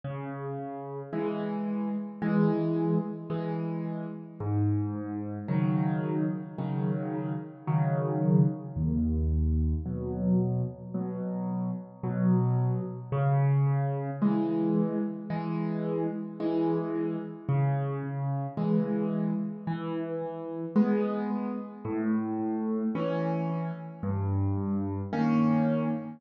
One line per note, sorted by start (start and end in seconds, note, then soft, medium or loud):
0.04 1.02 C#3 medium
1.13 1.89 E3 medium
1.13 1.89 G#3 medium
2.22 2.98 E3 medium
2.22 2.98 G#3 loud
3.30 4.06 E3 medium
3.30 4.06 G#3 medium
4.40 5.38 G#2 loud
5.48 6.25 C#3 medium
5.48 6.25 D#3 medium
5.48 6.25 F#3 medium
6.58 7.35 C#3 medium
6.58 7.35 D#3 medium
6.58 7.35 F#3 medium
7.67 8.44 C#3 medium
7.67 8.44 D#3 medium
7.67 8.44 F#3 medium
8.76 9.74 D#2 loud
9.85 10.62 B2 medium
9.85 10.62 F#3 medium
10.94 11.71 B2 medium
10.94 11.71 F#3 medium
12.03 12.80 B2 medium
12.03 12.80 F#3 medium
13.12 14.10 C#3 loud
14.22 14.98 E3 medium
14.22 14.98 G#3 medium
15.30 16.06 E3 medium
15.30 16.06 G#3 medium
16.40 17.16 E3 medium
16.40 17.16 G#3 medium
17.49 18.47 C#3 loud
18.57 19.34 E3 medium
18.57 19.34 G#3 medium
19.67 20.65 E3 loud
20.76 21.52 G#3 medium
20.76 21.52 B3 medium
21.85 22.83 A2 loud
22.95 23.71 E3 medium
22.95 23.71 C#4 medium
24.03 25.01 G2 loud
25.13 25.89 D#3 medium
25.13 25.89 A#3 medium
25.13 25.89 C#4 medium